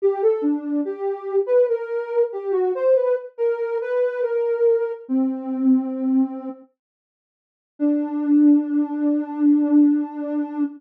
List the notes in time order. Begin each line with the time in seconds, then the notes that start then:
0.02 G4
0.22 A4
0.42 D4
0.85 G4
1.46 B4
1.69 A#4
2.32 G4
2.52 F#4
2.75 C5
2.96 B4
3.38 A#4
3.81 B4
4.22 A#4
5.08 C4
7.79 D4